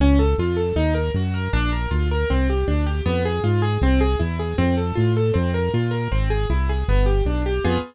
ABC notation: X:1
M:4/4
L:1/8
Q:1/4=157
K:Edor
V:1 name="Acoustic Grand Piano"
C A ^E A ^D ^A F A | D ^A ^E A =C G D G | _C _A =F A =C ^G E G | =C A =F A C _B F B |
^B, ^G E G =B, =G D G | [_C=F_A]2 z6 |]
V:2 name="Synth Bass 1" clef=bass
C,,2 ^E,,2 ^D,,2 F,,2 | ^A,,,2 D,,2 =C,,2 D,,2 | =F,,2 _A,,2 =C,,2 E,,2 | =F,,2 A,,2 F,,2 _B,,2 |
^G,,,2 ^B,,,2 =G,,,2 =B,,,2 | =F,,2 z6 |]